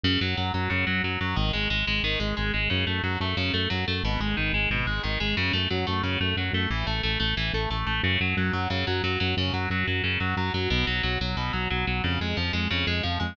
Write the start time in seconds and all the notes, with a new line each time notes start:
0.03 F#2 C#3
0.21 F#2 F#3
0.37 F#2 F#3
0.54 F#2 F#3
0.70 F#2 C#3
0.87 F#2 F#3
1.03 F#2 F#3
1.21 F#2 F#3
1.36 G#1 D#3
1.53 G#1 G#3
1.70 G#1 G#3
1.87 G#1 G#3
2.03 G#1 D#3
2.20 G#1 G#3
2.37 G#1 G#3
2.54 G#1 G#3
2.70 F#2 C#3
2.87 F#2 A3
3.03 F#2 F#3
3.20 F#2 A3
3.37 F#2 C#3
3.54 F#2 A3
3.70 F#2 F#3
3.88 F#2 A3
4.03 G#1 B2
4.20 G#1 G#3
4.37 G#1 D#3
4.53 G#1 G#3
4.70 G#1 B2
4.86 G#1 G#3
5.03 G#1 D#3
5.20 G#1 G#3
5.37 F#2 C#3
5.53 F#2 A3
5.70 F#2 F#3
5.87 F#2 A3
6.03 F#2 C#3
6.20 F#2 A3
6.36 F#2 F#3
6.53 F#2 A3
6.70 A1 E3
6.87 A1 A3
7.03 A1 A3
7.20 A1 A3
7.37 A1 E3
7.53 A1 A3
7.70 A1 A3
7.87 A1 A3
8.03 F#2 C#3
8.20 F#2 F#3
8.37 F#2 F#3
8.53 F#2 F#3
8.70 F#2 C#3
8.87 F#2 F#3
9.03 F#2 F#3
9.20 F#2 F#3
9.37 F#2 C#3
9.53 F#2 F#3
9.70 F#2 F#3
9.87 F#2 F#3
10.04 F#2 C#3
10.20 F#2 F#3
10.37 F#2 F#3
10.54 F#2 F#3
10.70 B1 B2
10.87 B1 F#3
11.03 B1 F#3
11.21 B1 F#3
11.37 B1 B2
11.53 B1 F#3
11.70 B1 F#3
11.87 B1 F#3
12.04 F2 C#3
12.20 F2 G#3
12.37 F2 F3
12.53 F2 G#3
12.71 F2 C#3
12.87 F2 G#3
13.03 F2 F3
13.20 F2 G#3